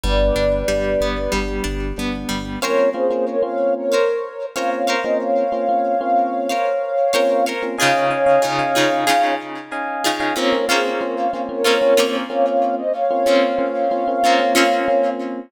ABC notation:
X:1
M:4/4
L:1/16
Q:1/4=93
K:Am
V:1 name="Ocarina"
[Bd]10 z6 | [K:Bbm] [Bd]2 [Ac]2 [Bd] [df]2 [Bd]5 [df] [df]2 [ce] | [df]16 | [df]10 z6 |
[Bd]2 [Ac]2 [Bd] [df]2 [Bd]5 [df] [df]2 [ce] | [df]16 |]
V:2 name="Electric Piano 1"
[G,B,D]4 [G,B,D]4 [G,B,D]4 [G,B,D]4 | [K:Bbm] [B,CDF]2 [B,CDF] [B,CDF]2 [B,CDF]7 [B,CDF]3 [B,CDF]- | [B,CDF]2 [B,CDF] [B,CDF]2 [B,CDF]7 [B,CDF]3 [B,CDF] | [Defa]2 [Defa] [Defa]2 [Defa]7 [Defa]3 [Defa] |
[B,CDF] [B,CDF] [B,CDF]2 [B,CDF]2 [B,CDF] [B,CDF] [B,CDF] [B,CDF]3 [B,CDF]4- | [B,CDF] [B,CDF] [B,CDF]2 [B,CDF]2 [B,CDF] [B,CDF] [B,CDF] [B,CDF]3 [B,CDF]4 |]
V:3 name="Acoustic Guitar (steel)"
G,2 D2 G,2 B,2 G,2 D2 B,2 G,2 | [K:Bbm] [Bcdf]8 [Bcdf]4 [Bcdf]2 [Bcdf]2- | [Bcdf]8 [Bcdf]4 [Bcdf]2 [Bcdf]2 | [D,EFA]4 [D,EFA]2 [D,EFA]2 [D,EFA]6 [D,EFA]2 |
[B,CDF]2 [B,CDF]6 [B,CDF]2 [B,CDF]6- | [B,CDF]2 [B,CDF]6 [B,CDF]2 [B,CDF]6 |]
V:4 name="Synth Bass 1" clef=bass
G,,,2 G,,,2 G,,,2 G,,,2 G,,,2 G,,,2 G,,,2 G,,,2 | [K:Bbm] z16 | z16 | z16 |
z16 | z16 |]